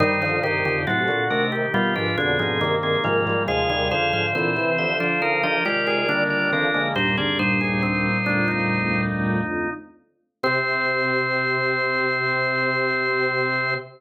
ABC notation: X:1
M:4/4
L:1/16
Q:1/4=69
K:Cm
V:1 name="Drawbar Organ"
[Ec]2 [Ec]2 [C=A]2 [DB] z [=B,G] [D=B] [C_A]3 [CA] [A,F]2 | [Af]2 [Af]2 [=Ec]2 [G=e] z [_Ec] [G_e] [Fd]3 [Fd] [DB]2 | [B,G] [CA] [Ec]8 z6 | c16 |]
V:2 name="Drawbar Organ"
E E G G ^F3 G =F F D E B,4 | A A c c c3 c B B G A D4 | c d c A C2 D E7 z2 | C16 |]
V:3 name="Drawbar Organ"
[G,,E,]2 [G,,E,] [F,,D,] [=A,,^F,] z [C,=A,]2 [=B,,G,] [_A,,=F,] [F,,D,] [A,,F,] [G,,E,]2 [A,,F,] [A,,F,] | [E,,C,] [E,,C,] [F,,D,] [A,,F,] [=E,C]3 [F,D] z [F,D] [A,F]2 [D,B,]2 [_E,C] [D,B,] | [B,,G,] [D,B,] [B,,G,]10 z4 | C16 |]
V:4 name="Drawbar Organ" clef=bass
[E,G,] [D,F,] [C,E,]2 [=A,,C,] [B,,D,] [C,E,]4 [=B,,D,] [B,,D,] [C,E,]2 [C,E,] [E,G,] | [F,A,] [E,G,] [D,F,]2 [B,,D,] [C,=E,] [D,F,]4 [C,_E,] [C,E,] [E,G,]2 [D,F,] [F,A,] | [E,,G,,]6 [D,,F,,]8 z2 | C,16 |]